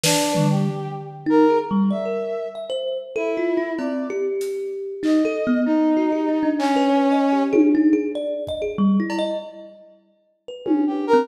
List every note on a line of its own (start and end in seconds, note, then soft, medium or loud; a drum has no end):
0.04 0.46 D4 medium
0.04 0.32 B4 loud
0.04 snare loud
0.35 0.65 G3 medium
0.35 floor tom medium
0.51 0.93 G4 medium
0.66 floor tom medium
1.26 1.45 D#4 loud
1.26 1.58 A#4 medium
1.50 1.69 G#4 medium
1.71 1.90 G3 loud
1.90 2.05 D5 medium
1.90 2.47 E5 medium
2.05 2.48 A#4 medium
2.55 2.69 E5 medium
2.70 2.98 C5 medium
3.16 3.72 E4 medium
3.16 3.35 A4 loud
3.37 3.56 F4 medium
3.57 3.76 E4 medium
3.79 4.07 C4 medium
3.79 4.07 D5 medium
3.79 cowbell medium
4.10 4.94 G4 loud
4.41 closed hi-hat medium
5.03 5.22 D#4 medium
5.03 5.61 D#5 medium
5.03 clap medium
5.25 5.44 A4 loud
5.47 5.66 B3 loud
5.65 6.50 D#4 medium
5.65 5.95 D#4 medium
5.97 6.11 F#4 medium
6.12 6.26 G4 medium
6.29 6.43 D#4 medium
6.43 6.71 D4 medium
6.59 7.43 C#4 loud
6.59 clap medium
6.76 6.90 B4 medium
6.89 7.08 C#5 medium
7.11 7.30 D#5 medium
7.33 7.51 G4 medium
7.53 7.71 G#4 loud
7.53 high tom loud
7.75 7.93 D#4 medium
7.93 8.12 G#4 medium
8.15 8.43 D5 medium
8.47 8.62 D#5 medium
8.47 kick medium
8.62 8.76 G#4 medium
8.78 8.97 G3 loud
9.00 9.18 E4 medium
9.10 cowbell loud
9.19 9.37 D#5 loud
10.48 10.90 B4 medium
10.65 10.84 C#4 medium
10.65 high tom loud
10.87 11.05 G4 medium
11.07 11.26 A#4 loud
11.13 11.27 C4 loud